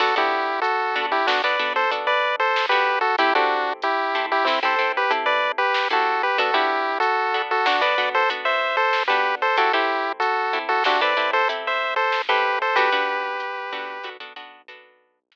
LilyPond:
<<
  \new Staff \with { instrumentName = "Lead 1 (square)" } { \time 5/4 \key b \phrygian \tempo 4 = 94 <fis' a'>16 <e' g'>8. <fis' a'>8. <e' g'>16 <d' fis'>16 <b' d''>8 <a' c''>16 r16 <b' d''>8 <a' c''>8 <g' b'>8 <fis' a'>16 | <e' g'>16 <d' fis'>8. <e' g'>8. <e' g'>16 <c' e'>16 <a' c''>8 <g' b'>16 r16 <b' d''>8 <g' b'>8 <fis' a'>8 <g' b'>16 | <fis' a'>16 <e' g'>8. <fis' a'>8. <fis' a'>16 <d' fis'>16 <b' d''>8 <a' c''>16 r16 <c'' e''>8 <a' c''>8 <g' b'>8 <a' c''>16 | <fis' a'>16 <e' g'>8. <fis' a'>8. <fis' a'>16 <d' fis'>16 <b' d''>8 <a' c''>16 r16 <c'' e''>8 <a' c''>8 <g' b'>8 <a' c''>16 |
<g' b'>2~ <g' b'>8 r2 r8 | }
  \new Staff \with { instrumentName = "Acoustic Guitar (steel)" } { \time 5/4 \key b \phrygian <b d' fis' a'>16 <b d' fis' a'>4~ <b d' fis' a'>16 <b d' fis' a'>8 <b d' fis' a'>16 <b d' fis' a'>16 <b d' fis' a'>8 <b d' fis' a'>4~ <b d' fis' a'>16 <b d' fis' a'>8. | <c' e' g' a'>16 <c' e' g' a'>4~ <c' e' g' a'>16 <c' e' g' a'>8 <c' e' g' a'>16 <c' e' g' a'>16 <c' e' g' a'>8 <c' e' g' a'>4~ <c' e' g' a'>16 <c' e' g' a'>8. | <b d' fis' a'>16 <b d' fis' a'>4~ <b d' fis' a'>16 <b d' fis' a'>8 <b d' fis' a'>16 <b d' fis' a'>16 <b d' fis' a'>8 <b d' fis' a'>4~ <b d' fis' a'>16 <b d' fis' a'>8. | <c' e' g' a'>16 <c' e' g' a'>4~ <c' e' g' a'>16 <c' e' g' a'>8 <c' e' g' a'>16 <c' e' g' a'>16 <c' e' g' a'>8 <c' e' g' a'>4~ <c' e' g' a'>16 <c' e' g' a'>8. |
<b d' fis' a'>16 <b d' fis' a'>4~ <b d' fis' a'>16 <b d' fis' a'>8 <b d' fis' a'>16 <b d' fis' a'>16 <b d' fis' a'>8 <b d' fis' a'>4~ <b d' fis' a'>16 r8. | }
  \new Staff \with { instrumentName = "Synth Bass 1" } { \clef bass \time 5/4 \key b \phrygian b,,1~ b,,4 | a,,1~ a,,4 | b,,1~ b,,4 | a,,1~ a,,4 |
b,,1~ b,,4 | }
  \new DrumStaff \with { instrumentName = "Drums" } \drummode { \time 5/4 <cymc bd>4 hh4 sn4 hh4 sn4 | <hh bd>4 hh4 sn4 hh4 sn4 | <hh bd>4 hh4 sn4 hh4 sn4 | hh8 bd8 hh4 sn4 hh4 sn4 |
<hh bd>4 hh4 hh4 hh4 sn4 | }
>>